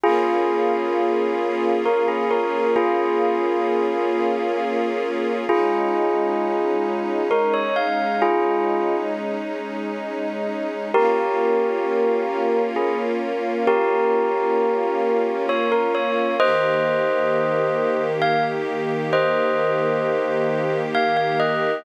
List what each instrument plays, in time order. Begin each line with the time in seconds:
0.04 string ensemble 1 A#3 C#4 F4 G#4, tubular bells F4 G#4
1.86 tubular bells A#4
2.08 tubular bells G#4
2.31 tubular bells A#4
2.76 tubular bells F4 G#4
5.49 string ensemble 1 G#3 C#4 D#4, tubular bells F4 G#4
7.31 tubular bells A#4
7.54 tubular bells C#5
7.76 tubular bells F5
8.22 tubular bells F4 G#4
10.94 string ensemble 1 A#3 C#4 F4, tubular bells G4 A#4
12.76 tubular bells G#4
13.67 tubular bells G4 A#4
15.49 tubular bells C#5
15.72 tubular bells A#4
15.95 tubular bells C#5
16.39 string ensemble 1 D#3 A#3 G4, tubular bells C5 D#5
18.22 tubular bells F5
19.13 tubular bells C5 D#5
20.95 tubular bells F5
21.17 tubular bells F5
21.40 tubular bells D#5